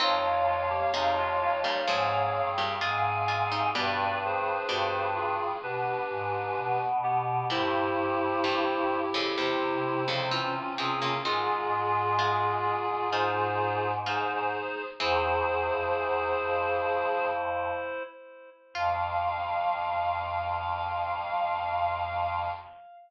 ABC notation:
X:1
M:4/4
L:1/16
Q:1/4=64
K:Fm
V:1 name="Clarinet"
[df]12 [fa]4 | [=B=d]2 [Ac]4 [FA]2 [GB]6 z2 | [=EG]12 [DF]4 | [FA]12 [Ac]4 |
[Ac]10 z6 | f16 |]
V:2 name="Clarinet"
[A,F]2 [A,F] [B,G] [G,E] [A,F] [A,F] [G,E] [CA]4 [CA]4 | [=D=B]8 [DB]6 [=B,G]2 | [=Ec]8 [Ec]6 [CA]2 | [A,F]8 [Ec]4 [Ec]4 |
[=Ec]14 z2 | f16 |]
V:3 name="Harpsichord"
[E,C]4 [C,A,]3 [B,,G,] [A,,F,]3 [B,,G,] [A,F]2 [A,F] [G,E] | [=B,,G,]4 [B,,G,]8 z4 | [B,,G,]4 [G,,=E,]3 [F,,D,] [=E,,C,]3 [F,,D,] [E,C]2 [E,C] [D,B,] | [E,C]4 [A,F]4 [A,F]4 [A,F]4 |
[=E,C]6 z10 | F16 |]
V:4 name="Choir Aahs" clef=bass
F,,4 F,,4 A,,2 G,,2 A,,4 | G,,4 G,,4 =B,,2 A,,2 B,,4 | G,,8 C,8 | A,,16 |
=E,,2 E,, F,, E,,2 F,,6 z4 | F,,16 |]